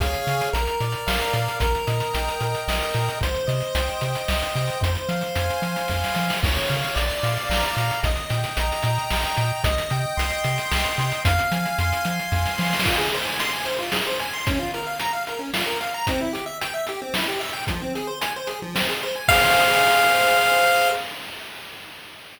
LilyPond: <<
  \new Staff \with { instrumentName = "Lead 1 (square)" } { \time 3/4 \key aes \major \tempo 4 = 112 r2. | r2. | r2. | r2. |
r2. | r2. | r2. | r2. |
\key f \minor r2. | r2. | r2. | r2. |
f''2. | }
  \new Staff \with { instrumentName = "Lead 1 (square)" } { \time 3/4 \key aes \major <aes' des'' f''>4 bes'8 d''8 f''8 bes'8 | bes'8 ees''8 g''8 bes'8 ees''8 g''8 | c''8 ees''8 g''8 c''8 ees''8 g''8 | c''8 f''8 aes''8 c''8 f''8 aes''8 |
des''8 f''8 d''8 f''8 bes''8 d''8 | ees''8 g''8 bes''8 ees''8 g''8 bes''8 | ees''8 g''8 c'''8 ees''8 g''8 c'''8 | f''8 aes''8 c'''8 f''8 aes''8 c'''8 |
\key f \minor f'16 aes'16 c''16 aes''16 c'''16 aes''16 c''16 f'16 aes'16 c''16 aes''16 c'''16 | des'16 f'16 bes'16 f''16 bes''16 f''16 bes'16 des'16 f'16 bes'16 f''16 bes''16 | c'16 e'16 g'16 e''16 g''16 e''16 g'16 c'16 e'16 g'16 e''16 g''16 | f16 c'16 aes'16 c''16 aes''16 c''16 aes'16 f16 c'16 aes'16 c''16 aes''16 |
<aes' c'' f''>2. | }
  \new Staff \with { instrumentName = "Synth Bass 1" } { \clef bass \time 3/4 \key aes \major des,8 des8 bes,,8 bes,8 bes,,8 bes,8 | bes,,8 bes,8 bes,,8 bes,8 bes,,8 bes,8 | c,8 c8 c,8 c8 c,8 c8 | f,8 f8 f,8 f8 f,8 f8 |
des,8 des8 bes,,8 bes,8 bes,,8 bes,8 | bes,,8 bes,8 bes,,8 bes,8 bes,,8 bes,8 | c,8 c8 c,8 c8 c,8 c8 | f,8 f8 f,8 f8 f,8 f8 |
\key f \minor r2. | r2. | r2. | r2. |
r2. | }
  \new DrumStaff \with { instrumentName = "Drums" } \drummode { \time 3/4 <hh bd>16 hh16 hh16 hh16 hh16 hh16 hh16 hh16 sn16 hh16 hh16 hh16 | <hh bd>16 hh16 hh16 hh16 hh16 hh16 hh16 hh16 sn16 hh16 hh16 hh16 | <hh bd>16 hh16 hh16 hh16 hh16 hh16 hh16 hh16 sn16 hh16 hh16 hh16 | <hh bd>16 hh16 hh16 hh16 hh16 hh16 hh16 hh16 <bd sn>16 sn16 sn16 sn16 |
<cymc bd>16 hh16 hh16 hh16 hh16 hh16 hh16 hh16 sn16 hh16 hh16 hh16 | <hh bd>16 hh16 hh16 hh16 hh16 hh16 hh16 hh16 sn16 hh16 hh8 | <hh bd>16 hh16 hh8 hh16 hh16 hh16 hh16 sn16 hh16 hh16 hh16 | <hh bd>16 hh16 hh16 hh16 hh16 hh16 hh16 hh16 <bd sn>16 sn16 sn32 sn32 sn32 sn32 |
<cymc bd>8 hh8 hh8 hh8 sn8 hh8 | <hh bd>8 hh8 hh8 hh8 sn8 hh8 | <hh bd>8 hh8 hh8 hh8 sn8 hho8 | <hh bd>8 hh8 hh8 hh8 sn8 hh8 |
<cymc bd>4 r4 r4 | }
>>